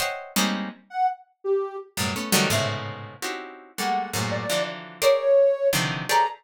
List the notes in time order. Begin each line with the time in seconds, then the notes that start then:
0.00 C5 C#5 D#5 E5 F#5 G5
0.36 G3 G#3 A#3 C4 C#4 D#4
0.90 F#5
1.44 G4
1.97 F#2 G2 A2 B2
2.16 A3 B3 C#4
2.32 D3 D#3 E3 F#3 G3 A3
2.50 G#2 A2 B2 C3 C#3 E5
3.22 C4 C#4 D#4 E4 F#4 G4
3.77 G3 G#3 A3 A#3 F#5
4.13 F#2 G#2 A2 A#2
4.31 D5
4.49 D3 E3 F3 F#3
5.02 G#4 A#4 C5 C#5 D5
5.73 C3 D3 D#3 E3 F3
6.09 G4 G#4 A4 B4 C#5 D5 A#5